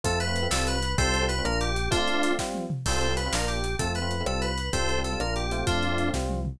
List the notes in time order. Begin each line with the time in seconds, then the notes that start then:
0.03 F2 A3 C4 F4 A4, kick, closed hi-hat
0.20 B4, closed hi-hat
0.27 A3 C4 F4
0.36 closed hi-hat
0.42 A3 C4 F4
0.51 C2 G3 C4 F4 A4, snare
0.67 B4, closed hi-hat
0.82 closed hi-hat
0.97 C2 G3 C4 F4 A4 C5, kick, closed hi-hat
1.14 closed hi-hat
1.21 G3 C4 F4
1.29 B4, closed hi-hat
1.38 G3 C4 F4
1.44 A#1 A#3 D4 F4 A#4, cross-stick
1.61 G4, closed hi-hat
1.76 closed hi-hat
1.90 A3 C4 D4 F4, kick, closed hi-hat
2.08 closed hi-hat
2.14 A3 C4 F4
2.23 closed hi-hat
2.30 A3 C4 F4
2.39 G3 C4 F4, kick, snare
2.54 high tom
2.70 mid tom
2.86 C2 G3 C4 F4 A4 C5, kick, crash
3.01 closed hi-hat
3.08 G3 C4 F4
3.17 B4, closed hi-hat
3.26 G3 C4 F4
3.32 A#1 A#3 D4 F4 A#4, snare
3.48 G4, closed hi-hat
3.64 closed hi-hat
3.79 F2 A3 C4 F4 A4, kick, closed hi-hat
3.95 B4, closed hi-hat
4.02 A3 C4 F4
4.11 closed hi-hat
4.20 A3 C4 F4
4.26 C2 G3 C4 F4 A4, cross-stick
4.42 B4, closed hi-hat
4.58 closed hi-hat
4.72 C2 G3 C4 F4 A4 C5, kick, closed hi-hat
4.89 closed hi-hat
4.97 G3 C4 F4
5.04 A4, closed hi-hat
5.12 G3 C4 F4
5.19 A#1 A#3 D4 F4 A#4, cross-stick
5.36 G4, closed hi-hat
5.51 A3 C4 F4, closed hi-hat
5.67 F2 D4 F4, kick, closed hi-hat
5.83 closed hi-hat
5.91 A3 C4 F4
5.98 closed hi-hat
6.07 A3 C4 F4
6.14 C2 G3 C4 F4, kick, snare
6.29 high tom
6.45 mid tom